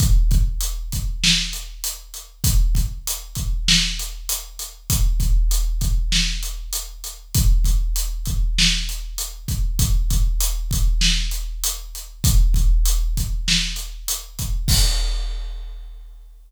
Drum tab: CC |--------|--------|--------|--------|
HH |xxxx-xxx|xxxx-xxx|xxxx-xxx|xxxx-xxx|
SD |----o---|----o---|----o---|----o---|
BD |oo-o----|oo-o----|oo-o----|oo-o---o|

CC |--------|--------|x-------|
HH |xxxx-xxx|xxxx-xxx|--------|
SD |----o---|----o---|--------|
BD |oo-o----|oo-o---o|o-------|